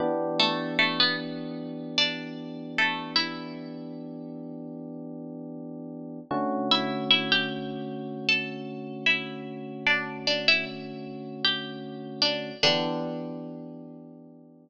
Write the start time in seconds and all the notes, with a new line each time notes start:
0.00 E3 B3 D4 G4
0.39 A3 A4
0.79 A3 A4
1.00 B3 B4
1.98 D4 D5
2.78 A3 A4
3.16 E4 E5
6.31 D3 A3 C#4 F#4
6.71 E4 E5
7.11 E4 E5
7.32 G4 G5
8.29 A4 A5
9.06 E4 E5
9.87 D4 D5
10.27 D4 D5
10.48 E4 E5
11.45 G4 G5
12.22 D4 D5
12.63 D3 E3 B3 D4 G4